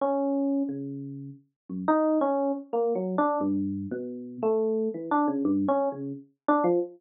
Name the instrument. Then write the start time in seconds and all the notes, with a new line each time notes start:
electric piano 1
0.01 C#4
0.69 C#3
1.69 F#2
1.88 D#4
2.21 C#4
2.73 A#3
2.95 F#3
3.18 D4
3.41 G2
3.91 B2
4.43 A3
4.94 E3
5.11 D4
5.28 C#3
5.45 G2
5.68 C#4
5.92 C#3
6.48 D4
6.64 F3